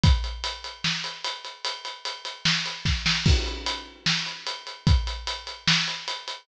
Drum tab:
CC |--------|--------|x-------|--------|
HH |xxxx-xxx|xxxx-x--|-xx--xxx|xxxx-xxx|
SD |----o---|----o-oo|----o---|----o---|
BD |o-------|------o-|o-------|o-------|